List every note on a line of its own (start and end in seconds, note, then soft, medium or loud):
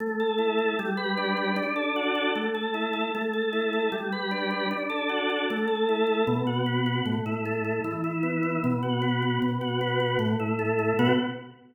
0.00 0.74 A3 medium
0.20 0.58 A4 medium
0.38 0.75 E4 medium
0.58 0.77 A4 medium
0.79 1.54 G3 loud
0.97 1.36 B4 medium
1.17 1.55 D4 medium
1.37 1.56 B4 medium
1.56 2.31 D4 loud
1.76 2.15 A4 medium
1.96 2.33 F#4 medium
2.15 2.34 A4 medium
2.35 3.10 A3 medium
2.54 2.93 A4 medium
2.74 3.11 E4 medium
2.93 3.12 A4 medium
3.14 3.89 A3 medium
3.33 3.72 A4 medium
3.53 3.90 E4 medium
3.73 3.92 A4 medium
3.92 4.66 G3 loud
4.12 4.50 B4 medium
4.31 4.68 D4 medium
4.50 4.69 B4 medium
4.71 5.45 D4 loud
4.89 5.29 A4 medium
5.09 5.46 F#4 medium
5.30 5.48 A4 medium
5.50 6.25 A3 loud
5.67 6.06 A4 medium
5.89 6.26 E4 medium
6.07 6.25 A4 medium
6.27 7.02 B2 loud
6.47 6.86 F#4 medium
6.66 7.03 B3 medium
6.86 7.05 F#4 medium
7.05 7.80 A2 medium
7.26 7.64 E4 medium
7.45 7.83 A3 medium
7.64 7.83 E4 medium
7.84 8.59 E3 medium
8.04 8.42 E4 medium
8.23 8.60 B3 medium
8.43 8.61 E4 medium
8.64 9.38 B2 loud
8.82 9.22 F#4 medium
9.02 9.39 B3 medium
9.22 9.41 F#4 medium
9.42 10.16 B2 medium
9.61 9.99 F#4 medium
9.81 10.18 B3 medium
10.00 10.19 F#4 medium
10.19 10.93 A2 loud
10.40 10.78 E4 medium
10.59 10.96 A3 medium
10.79 10.97 E4 medium
10.99 11.13 B2 loud
10.99 11.13 B3 loud
10.99 11.13 F#4 loud